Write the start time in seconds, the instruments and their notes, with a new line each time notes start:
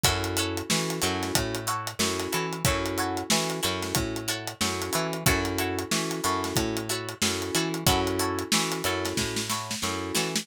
0.04 electric bass (finger) F#2, electric piano 2 C#4 E4 F#4 A4, pizzicato strings E4 F#4 A4 C#5, kick, closed hi-hat
0.24 closed hi-hat
0.37 pizzicato strings E4 F#4 A4 C#5, closed hi-hat
0.57 closed hi-hat
0.69 electric bass (finger) E3, electric piano 2 C#4 E4 F#4 A4, snare
0.90 closed hi-hat
1.02 electric bass (finger) F#2, electric piano 2 C#4 E4 F#4 A4, pizzicato strings E4 F#4 A4 C#5, closed hi-hat
1.23 snare, closed hi-hat
1.35 electric bass (finger) A2, kick, closed hi-hat
1.55 closed hi-hat
1.67 pizzicato strings E4 F#4 A4 C#5, closed hi-hat
1.87 closed hi-hat
1.99 electric bass (finger) F#2, electric piano 2 C#4 E4 F#4 A4, snare
2.20 snare, closed hi-hat
2.32 electric bass (finger) E3, pizzicato strings E4 F#4 A4 C#5, closed hi-hat
2.53 closed hi-hat
2.65 electric bass (finger) F#2, electric piano 2 C#4 E4 F#4 A4, pizzicato strings E4 F#4 A4 C#5, kick, closed hi-hat
2.86 closed hi-hat
2.98 pizzicato strings E4 F#4 A4 C#5, closed hi-hat
3.17 closed hi-hat
3.30 electric bass (finger) E3, electric piano 2 C#4 E4 F#4 A4, snare
3.50 closed hi-hat
3.63 electric bass (finger) F#2, electric piano 2 C#4 E4 F#4 A4, pizzicato strings E4 F#4 A4 C#5, closed hi-hat
3.82 snare, closed hi-hat
3.95 electric bass (finger) A2, kick, closed hi-hat
4.16 closed hi-hat
4.28 pizzicato strings E4 F#4 A4 C#5, closed hi-hat
4.47 closed hi-hat
4.61 electric bass (finger) F#2, electric piano 2 C#4 E4 F#4 A4, snare
4.82 closed hi-hat
4.93 electric bass (finger) E3, pizzicato strings E4 F#4 A4 C#5, closed hi-hat
5.13 closed hi-hat
5.26 electric bass (finger) F#2, electric piano 2 C#4 E4 F#4 A4, pizzicato strings E4 F#4 A4 C#5, kick, closed hi-hat
5.45 closed hi-hat
5.58 pizzicato strings E4 F#4 A4 C#5, closed hi-hat
5.79 closed hi-hat
5.91 electric bass (finger) E3, electric piano 2 C#4 E4 F#4 A4, snare
6.11 closed hi-hat
6.24 electric bass (finger) F#2, electric piano 2 C#4 E4 F#4 A4, pizzicato strings E4 F#4 A4 C#5, closed hi-hat
6.44 snare, closed hi-hat
6.56 electric bass (finger) A2, kick, closed hi-hat
6.77 closed hi-hat
6.89 pizzicato strings E4 F#4 A4 C#5, closed hi-hat
7.09 closed hi-hat
7.22 electric bass (finger) F#2, electric piano 2 C#4 E4 F#4 A4, snare
7.42 closed hi-hat
7.55 electric bass (finger) E3, pizzicato strings E4 F#4 A4 C#5, closed hi-hat
7.74 closed hi-hat
7.86 electric bass (finger) F#2, electric piano 2 C#4 E4 F#4 A4, pizzicato strings E4 F#4 A4 C#5, kick, closed hi-hat
8.07 closed hi-hat
8.19 pizzicato strings E4 F#4 A4 C#5, closed hi-hat
8.39 closed hi-hat
8.52 electric bass (finger) E3, electric piano 2 C#4 E4 F#4 A4, snare
8.72 closed hi-hat
8.84 electric bass (finger) F#2, electric piano 2 C#4 E4 F#4 A4, pizzicato strings E4 F#4 A4 C#5, closed hi-hat
9.05 snare, closed hi-hat
9.17 electric bass (finger) A2, kick, snare
9.36 snare
9.50 pizzicato strings E4 F#4 A4 C#5, snare
9.71 snare
9.82 electric bass (finger) F#2, electric piano 2 C#4 E4 F#4 A4, snare
10.15 electric bass (finger) E3, pizzicato strings E4 F#4 A4 C#5, snare
10.36 snare